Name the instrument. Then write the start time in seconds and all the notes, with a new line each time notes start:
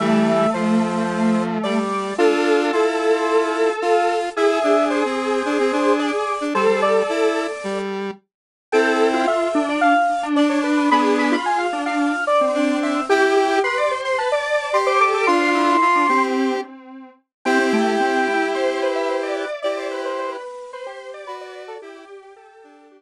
lead 1 (square)
0.00 E3 G3 A3 E5
0.54 F3 C5
1.64 G3 D5
2.18 D4 F4 A4
2.73 E4 F4
3.81 F4
4.36 E4 G#4 E5
4.64 D4
4.90 C5
5.05 C4
5.45 D4
5.59 C4
5.72 D4
5.99 D5
6.41 D4
6.55 G3 A4 C5
6.68 G3
6.82 D5
7.09 E4
7.64 G3
8.72 C4 E4 A4 G5
9.14 F4
9.27 E5
9.55 D4
9.69 D5
9.81 F5
10.23 D4
10.36 D4 D5
10.50 C#5
10.64 B4
10.77 B4
10.91 B3 D4 G#4 B5
11.19 B5
11.32 F4 B5
11.46 G#5
11.58 F5
11.73 D4
11.86 F5
12.27 D5
12.41 C4
12.55 D4
12.83 E5
13.09 E4 G4 G5
13.36 G4
13.64 B4 C6
13.77 D5
13.91 C5
14.05 C6
14.18 B4 A5
14.32 D5
14.73 G4 C6
14.86 C5 D6
15.00 A4 D6
15.14 A4 D6
15.27 D4 F4 C6
15.55 E4
15.81 F4
15.95 D4
16.09 C4 G4
17.45 C4 E4 G4 G5
17.59 C4
17.73 A3 G5
18.00 C4
18.27 E4
18.55 C5
18.82 B4 C5
18.95 E5
19.09 C5
19.23 D5
19.36 D5
19.62 E4 G4 D5
19.77 C5
19.91 B4
20.05 C5
20.18 C5
20.31 B4
20.73 B4 C5
20.86 G4 C5
21.14 D5
21.27 F#4 B4
21.41 D5
21.55 D5
21.68 A4
21.82 E4 G4
22.22 G4
22.36 G4 A4
22.64 D4
22.91 G4